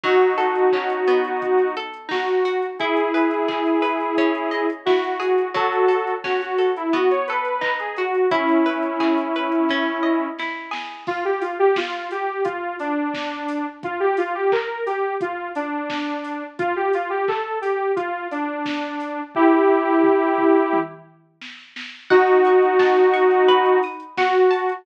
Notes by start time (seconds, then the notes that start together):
0.04 F#3 D#4 F#4, kick, crash
0.21 closed hi-hat
0.38 A4, open hi-hat
0.55 closed hi-hat
0.72 C#4, kick, clap
0.90 closed hi-hat
1.07 B3, open hi-hat
1.25 closed hi-hat
1.42 kick, closed hi-hat
1.58 closed hi-hat
1.76 A4, open hi-hat
1.94 closed hi-hat
2.09 D#4 F#4, kick, snare
2.28 closed hi-hat
2.45 F#4, open hi-hat
2.62 closed hi-hat
2.79 E4 G#4, kick, closed hi-hat
2.97 closed hi-hat
3.14 B4, open hi-hat
3.31 closed hi-hat
3.48 G#4, kick, clap
3.66 closed hi-hat
3.82 B4, open hi-hat
4.00 closed hi-hat
4.17 C#4, kick, closed hi-hat
4.35 closed hi-hat
4.51 D#5, open hi-hat
4.70 closed hi-hat
4.86 E4 F#4, kick, snare
5.04 closed hi-hat
5.20 G#4, open hi-hat
5.38 closed hi-hat
5.54 F#3 F#4 A4, kick, closed hi-hat
5.72 closed hi-hat
5.88 A4, open hi-hat
6.07 closed hi-hat
6.24 C#4 F#4, kick, snare
6.41 F#4, closed hi-hat
6.58 A4, open hi-hat
6.77 E4, closed hi-hat
6.93 B3 F#4, kick, closed hi-hat
7.10 C#5, closed hi-hat
7.27 A4 B4, open hi-hat
7.45 closed hi-hat
7.61 D#4, kick, clap
7.79 G#4, closed hi-hat
7.97 F#4, open hi-hat
8.15 closed hi-hat
8.31 C#4 E4, kick, closed hi-hat
8.49 closed hi-hat
8.66 B4, open hi-hat
8.83 closed hi-hat
9.00 G#4, kick, clap
9.18 closed hi-hat
9.35 B4, open hi-hat
9.52 closed hi-hat
9.69 C#4, kick, snare
10.03 D#5
10.39 E4, snare
10.71 G#4, snare
11.07 F4, kick, crash
11.25 G4
11.41 F4, open hi-hat
11.59 G4
11.76 F4, kick, snare
12.11 G4, open hi-hat
12.45 F4, kick, closed hi-hat
12.79 D4, open hi-hat
13.14 kick, snare
13.48 open hi-hat
13.83 F4, kick, closed hi-hat
14.00 G4
14.17 F4, open hi-hat
14.35 G4
14.52 A#4, kick, clap
14.86 G4, open hi-hat
15.21 F4, kick, closed hi-hat
15.55 D4, open hi-hat
15.90 kick, snare
16.24 open hi-hat
16.59 F4, kick, closed hi-hat
16.76 G4
16.93 F4, open hi-hat
17.10 G4
17.28 A4, kick, clap
17.61 G4, open hi-hat
17.96 F4, kick, closed hi-hat
18.31 D4, open hi-hat
18.66 kick, snare
19.00 open hi-hat
19.35 E4 G4, kick, floor tom
19.69 floor tom
20.04 mid tom
20.38 mid tom
20.73 high tom
21.42 snare
21.76 snare
22.10 D#4 F#4 F#5, kick, crash
22.27 closed hi-hat
22.45 C#6, open hi-hat
22.62 closed hi-hat
22.79 A5, kick, snare
22.97 closed hi-hat
23.14 C#6, open hi-hat
23.31 closed hi-hat
23.48 B4, kick, closed hi-hat
23.66 closed hi-hat
23.83 D#6, open hi-hat
24.00 closed hi-hat
24.17 F#4 F#5, kick, snare
24.35 closed hi-hat
24.51 A5, open hi-hat
24.69 closed hi-hat